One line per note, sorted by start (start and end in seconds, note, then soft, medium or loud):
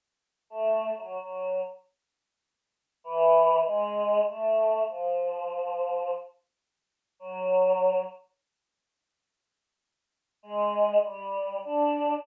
0.50 0.92 A3 medium
0.97 1.17 F#3 medium
1.19 1.61 F#3 medium
3.04 3.59 E3 loud
3.65 4.21 G#3 loud
4.27 4.82 A3 medium
4.88 6.13 F3 medium
7.19 8.03 F#3 medium
10.43 10.98 G#3 loud
11.03 11.59 G3 medium
11.65 12.20 D4 loud